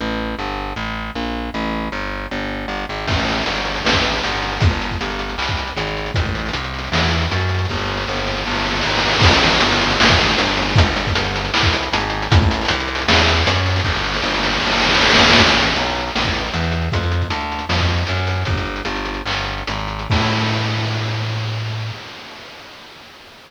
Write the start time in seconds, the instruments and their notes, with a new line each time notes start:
0.01 electric bass (finger) A1
0.39 electric bass (finger) G1
0.76 electric bass (finger) A1
1.15 electric bass (finger) A#1
1.54 electric bass (finger) A1
1.92 electric bass (finger) G1
2.31 electric bass (finger) G1
2.68 electric bass (finger) G1
2.89 electric bass (finger) G#1
3.07 electric bass (finger) A1, kick, crash
3.19 closed hi-hat
3.28 closed hi-hat
3.32 closed hi-hat
3.37 closed hi-hat
3.42 closed hi-hat
3.46 electric bass (finger) G1, closed hi-hat
3.56 closed hi-hat
3.65 closed hi-hat
3.76 closed hi-hat
3.85 electric bass (finger) A1, snare
3.93 kick, closed hi-hat
4.04 closed hi-hat
4.13 closed hi-hat
4.23 electric bass (finger) G1, closed hi-hat
4.32 closed hi-hat
4.42 closed hi-hat
4.48 closed hi-hat
4.52 closed hi-hat
4.57 closed hi-hat
4.60 electric bass (finger) G1, kick, closed hi-hat
4.71 closed hi-hat
4.82 closed hi-hat
4.90 kick, closed hi-hat
5.01 electric bass (finger) G1, closed hi-hat
5.10 closed hi-hat
5.19 closed hi-hat
5.29 closed hi-hat
5.38 electric bass (finger) C2, clap
5.48 kick, closed hi-hat
5.57 closed hi-hat
5.67 closed hi-hat
5.76 electric bass (finger) G#1, closed hi-hat
5.87 closed hi-hat
5.97 closed hi-hat
6.06 closed hi-hat
6.14 electric bass (finger) A1, kick, closed hi-hat
6.25 kick, closed hi-hat
6.35 closed hi-hat
6.39 closed hi-hat
6.46 closed hi-hat
6.48 closed hi-hat
6.53 electric bass (finger) C2, closed hi-hat
6.64 closed hi-hat
6.74 closed hi-hat
6.79 closed hi-hat
6.84 closed hi-hat
6.87 closed hi-hat
6.92 electric bass (finger) E2, snare
7.03 closed hi-hat
7.11 closed hi-hat
7.22 closed hi-hat
7.31 electric bass (finger) F#2, closed hi-hat
7.40 closed hi-hat
7.49 closed hi-hat
7.54 closed hi-hat
7.59 closed hi-hat
7.65 closed hi-hat
7.69 electric bass (finger) G1, kick, snare
7.78 snare
7.88 snare
7.97 snare
8.07 electric bass (finger) G1, snare
8.16 snare
8.27 snare
8.37 snare
8.45 electric bass (finger) G1, snare
8.50 snare
8.55 snare
8.60 snare
8.65 snare
8.70 snare
8.76 snare
8.81 snare
8.83 electric bass (finger) G#1, snare
8.89 snare
8.95 snare
8.99 snare
9.05 snare
9.09 snare
9.13 snare
9.19 kick, snare, crash
9.23 electric bass (finger) A1
9.31 closed hi-hat
9.43 closed hi-hat
9.47 closed hi-hat
9.53 closed hi-hat
9.56 closed hi-hat
9.61 electric bass (finger) G1, closed hi-hat
9.72 closed hi-hat
9.81 closed hi-hat
9.91 closed hi-hat
10.00 electric bass (finger) A1, snare
10.08 kick, closed hi-hat
10.21 closed hi-hat
10.30 closed hi-hat
10.38 electric bass (finger) G1, closed hi-hat
10.47 closed hi-hat
10.57 closed hi-hat
10.62 closed hi-hat
10.69 closed hi-hat
10.76 electric bass (finger) G1, kick, closed hi-hat
10.86 closed hi-hat
10.96 closed hi-hat
11.07 kick, closed hi-hat
11.15 electric bass (finger) G1, closed hi-hat
11.24 closed hi-hat
11.36 closed hi-hat
11.45 closed hi-hat
11.54 electric bass (finger) C2, clap
11.63 kick, closed hi-hat
11.73 closed hi-hat
11.83 closed hi-hat
11.93 electric bass (finger) G#1, closed hi-hat
12.00 closed hi-hat
12.10 closed hi-hat
12.22 closed hi-hat
12.31 electric bass (finger) A1, kick, closed hi-hat
12.42 kick, closed hi-hat
12.51 closed hi-hat
12.54 closed hi-hat
12.61 closed hi-hat
12.65 closed hi-hat
12.68 electric bass (finger) C2, closed hi-hat
12.80 closed hi-hat
12.87 closed hi-hat
12.95 closed hi-hat
12.98 closed hi-hat
13.02 closed hi-hat
13.08 electric bass (finger) E2, snare
13.18 closed hi-hat
13.28 closed hi-hat
13.37 closed hi-hat
13.46 electric bass (finger) F#2, closed hi-hat
13.56 closed hi-hat
13.66 closed hi-hat
13.70 closed hi-hat
13.76 closed hi-hat
13.80 closed hi-hat
13.84 electric bass (finger) G1, kick, snare
13.95 snare
14.04 snare
14.14 snare
14.22 electric bass (finger) G1, snare
14.34 snare
14.43 snare
14.52 snare
14.60 electric bass (finger) G1, snare
14.67 snare
14.72 snare
14.77 snare
14.80 snare
14.84 snare
14.89 snare
14.94 snare
14.99 electric bass (finger) G#1, snare
15.05 snare
15.10 snare
15.14 snare
15.19 snare
15.23 snare
15.30 snare
15.33 snare
15.37 electric bass (finger) A1, kick, closed hi-hat
15.48 closed hi-hat
15.57 closed hi-hat
15.62 closed hi-hat
15.69 closed hi-hat
15.73 closed hi-hat
15.76 electric bass (finger) B1, closed hi-hat
15.86 closed hi-hat
15.95 closed hi-hat
16.00 closed hi-hat
16.08 closed hi-hat
16.11 closed hi-hat
16.15 electric bass (finger) A1, snare
16.24 kick, closed hi-hat
16.34 closed hi-hat
16.39 closed hi-hat
16.44 closed hi-hat
16.49 closed hi-hat
16.54 electric bass (finger) E2, closed hi-hat
16.64 closed hi-hat
16.72 closed hi-hat
16.82 closed hi-hat
16.92 electric bass (finger) F2, kick, closed hi-hat
17.03 closed hi-hat
17.12 closed hi-hat
17.22 kick, closed hi-hat
17.30 electric bass (finger) D2, closed hi-hat
17.41 closed hi-hat
17.52 closed hi-hat
17.59 closed hi-hat
17.69 electric bass (finger) F2, snare
17.79 kick, closed hi-hat
17.89 closed hi-hat
17.97 closed hi-hat
18.07 electric bass (finger) F#2, closed hi-hat
18.17 closed hi-hat
18.27 closed hi-hat
18.30 closed hi-hat
18.36 closed hi-hat
18.41 closed hi-hat
18.45 electric bass (finger) G1, kick, closed hi-hat
18.56 kick, closed hi-hat
18.65 closed hi-hat
18.76 closed hi-hat
18.85 electric bass (finger) G1, closed hi-hat
18.96 closed hi-hat
19.05 closed hi-hat
19.14 closed hi-hat
19.26 electric bass (finger) G1, clap
19.36 closed hi-hat
19.45 closed hi-hat
19.58 closed hi-hat
19.67 electric bass (finger) G#1, closed hi-hat
19.78 closed hi-hat
19.88 closed hi-hat
19.99 closed hi-hat
20.10 electric bass (finger) A2, kick, crash